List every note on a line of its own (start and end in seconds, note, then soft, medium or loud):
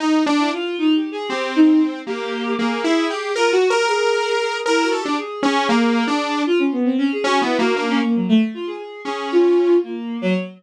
0.00 0.23 D#4 medium
0.26 0.50 D4 loud
0.38 0.49 E4 medium
0.53 0.76 F4 loud
0.78 0.94 D#4 loud
0.95 1.10 G4 medium
1.12 1.27 G#4 loud
1.28 1.99 C4 medium
1.28 1.51 G4 medium
1.56 1.79 D#4 loud
2.07 2.53 A#3 medium
2.07 2.53 G4 loud
2.58 2.82 A#3 medium
2.58 2.81 G#4 medium
2.84 3.07 E4 medium
2.84 3.32 G#4 medium
3.10 3.33 G4 medium
3.35 3.52 F4 medium
3.35 3.51 A#4 medium
3.52 3.68 F#4 loud
3.52 3.68 F#4 medium
3.70 3.86 G4 medium
3.70 3.86 A#4 loud
3.88 4.34 G#4 medium
3.88 4.58 A#4 medium
4.40 4.63 G#4 medium
4.66 4.82 E4 medium
4.66 4.89 A#4 medium
4.82 4.98 F#4 medium
4.92 5.03 A4 medium
5.00 5.16 G4 medium
5.05 5.17 D4 medium
5.18 5.88 G#4 medium
5.43 5.66 C#4 loud
5.69 6.04 A#3 loud
5.95 6.41 G#4 medium
6.07 6.42 D4 medium
6.47 6.58 F4 loud
6.59 6.70 C#4 medium
6.72 6.84 B3 medium
6.85 6.96 C4 medium
6.98 7.09 C#4 loud
7.12 7.24 G#4 medium
7.24 7.39 C#4 loud
7.24 7.40 F#4 medium
7.41 7.57 B3 medium
7.41 7.57 E4 medium
7.58 7.74 A#3 medium
7.58 7.74 F#4 medium
7.74 7.99 A#3 medium
7.74 7.86 D4 medium
7.89 8.00 C#4 loud
8.02 8.14 A#3 medium
8.15 8.27 F#3 soft
8.29 8.40 A3 loud
8.54 8.66 F4 medium
8.67 8.77 G#4 medium
8.78 9.01 G#4 medium
9.05 9.75 C#4 medium
9.05 9.28 G#4 medium
9.32 9.79 F4 loud
9.83 10.18 A#3 medium
10.21 10.33 F#3 loud